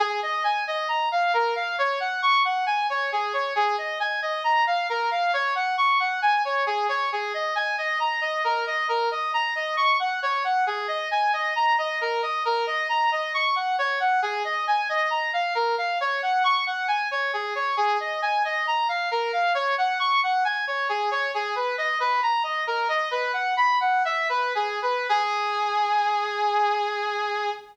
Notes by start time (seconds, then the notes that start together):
0.00 G#4
0.23 D#5
0.44 G#5
0.67 D#5
0.88 A#5
1.12 F5
1.34 A#4
1.56 F5
1.78 C#5
2.00 F#5
2.22 C#6
2.45 F#5
2.66 G#5
2.90 C#5
3.12 G#4
3.33 C#5
3.55 G#4
3.78 D#5
4.00 G#5
4.22 D#5
4.44 A#5
4.67 F5
4.89 A#4
5.11 F5
5.33 C#5
5.55 F#5
5.78 C#6
6.00 F#5
6.22 G#5
6.45 C#5
6.66 G#4
6.89 C#5
7.12 G#4
7.34 D#5
7.55 G#5
7.78 D#5
8.00 A#5
8.21 D#5
8.44 A#4
8.67 D#5
8.89 A#4
9.11 D#5
9.34 A#5
9.55 D#5
9.77 C#6
9.99 F#5
10.22 C#5
10.44 F#5
10.67 G#4
10.88 D#5
11.11 G#5
11.33 D#5
11.56 A#5
11.78 D#5
12.01 A#4
12.22 D#5
12.45 A#4
12.67 D#5
12.89 A#5
13.12 D#5
13.34 C#6
13.56 F#5
13.79 C#5
14.00 F#5
14.22 G#4
14.44 D#5
14.67 G#5
14.89 D#5
15.10 A#5
15.33 F5
15.55 A#4
15.78 F5
16.01 C#5
16.22 F#5
16.44 C#6
16.67 F#5
16.88 G#5
17.11 C#5
17.33 G#4
17.55 C#5
17.77 G#4
18.00 D#5
18.22 G#5
18.45 D#5
18.67 A#5
18.89 F5
19.11 A#4
19.33 F5
19.54 C#5
19.78 F#5
19.99 C#6
20.23 F#5
20.45 G#5
20.67 C#5
20.89 G#4
21.11 C#5
21.34 G#4
21.55 B4
21.78 D#5
22.00 B4
22.23 A#5
22.43 D#5
22.67 A#4
22.88 D#5
23.11 B4
23.33 F#5
23.57 B5
23.80 F#5
24.05 E5
24.29 B4
24.55 G#4
24.82 B4
25.09 G#4